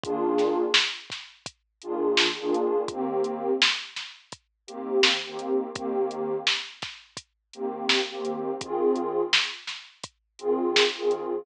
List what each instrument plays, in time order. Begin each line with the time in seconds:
0.04 pad 2 (warm) D#3 A#3 D4 F4 G#4, kick, closed hi-hat
0.38 snare, closed hi-hat
0.74 snare
1.10 kick, snare, closed hi-hat
1.46 kick, closed hi-hat
1.82 pad 2 (warm) D#3 A#3 D4 F4 G#4, closed hi-hat
2.17 snare
2.40 pad 2 (warm) D#3 A#3 D4 F4 G#4
2.54 closed hi-hat
2.88 pad 2 (warm) D#3 A#3 C4 G4, kick, closed hi-hat
3.24 closed hi-hat
3.62 snare
3.96 snare, closed hi-hat
4.32 kick, closed hi-hat
4.67 pad 2 (warm) D#3 A#3 C4 G4, closed hi-hat
5.03 snare
5.26 pad 2 (warm) D#3 A#3 C4 G4
5.39 closed hi-hat
5.75 pad 2 (warm) D#3 A#3 C4 G4, kick, closed hi-hat
6.11 closed hi-hat
6.47 snare
6.82 kick, snare, closed hi-hat
7.17 kick, closed hi-hat
7.53 pad 2 (warm) D#3 A#3 C4 G4, closed hi-hat
7.89 snare
8.11 pad 2 (warm) D#3 A#3 C4 G4
8.25 closed hi-hat
8.61 pad 2 (warm) D#3 C4 F4 G#4, kick, closed hi-hat
8.96 closed hi-hat
9.33 snare
9.67 snare, closed hi-hat
10.03 kick, closed hi-hat
10.39 pad 2 (warm) D#3 C4 F4 G#4, closed hi-hat
10.76 snare
10.97 pad 2 (warm) D#3 C4 F4 G#4
11.11 closed hi-hat